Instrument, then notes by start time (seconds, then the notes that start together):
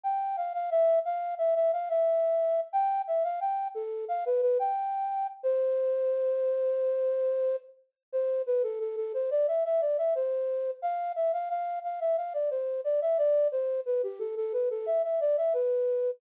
flute
0.04 G5
0.37 F5
0.54 F5
0.71 E5
1.05 F5
1.38 E5
1.55 E5
1.73 F5
1.89 E5
2.73 G5
3.07 E5
3.24 F5
3.41 G5
3.75 A4
4.08 F5
4.26 B4
4.42 B4
4.59 G5
5.43 C5
8.12 C5
8.46 B4
8.63 A4
8.80 A4
8.96 A4
9.14 C5
9.31 D5
9.48 E5
9.65 E5
9.81 D5
9.98 E5
10.15 C5
10.82 F5
11.16 E5
11.33 F5
11.50 F5
11.84 F5
12.00 E5
12.17 F5
12.34 D5
12.50 C5
12.84 D5
13.02 E5
13.18 D5
13.52 C5
13.86 B4
14.03 G4
14.19 A4
14.37 A4
14.53 B4
14.70 A4
14.86 E5
15.04 E5
15.21 D5
15.37 E5
15.54 B4